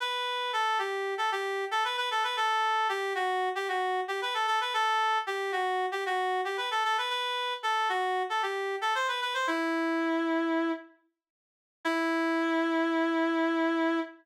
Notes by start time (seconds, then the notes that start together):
0.00 B4
0.53 A4
0.79 G4
1.18 A4
1.32 G4
1.71 A4
1.84 B4
1.97 B4
2.11 A4
2.24 B4
2.37 A4
2.89 G4
3.15 F#4
3.55 G4
3.68 F#4
4.08 G4
4.22 B4
4.34 A4
4.47 A4
4.61 B4
4.74 A4
5.27 G4
5.52 F#4
5.92 G4
6.06 F#4
6.45 G4
6.57 B4
6.71 A4
6.84 A4
6.98 B4
7.10 B4
7.63 A4
7.89 F#4
8.29 A4
8.42 G4
8.81 A4
8.95 C5
9.08 B4
9.21 B4
9.34 C5
9.47 E4
11.85 E4